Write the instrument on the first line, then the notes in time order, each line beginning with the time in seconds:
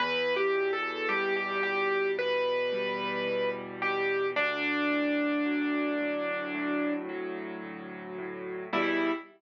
acoustic grand piano
0.00 E2 B4
0.36 G4
0.55 B2
0.73 A4
1.09 G3 G4
1.37 G4
1.63 E2 G4
2.18 B2 B4
2.72 G3
3.27 E2
3.82 B2 G4
4.36 D2 D4
4.91 A2
5.45 F#3
6.00 D2
6.54 A2
7.09 F#3
7.63 D2
8.18 A2
8.73 E2 B2 G3 E4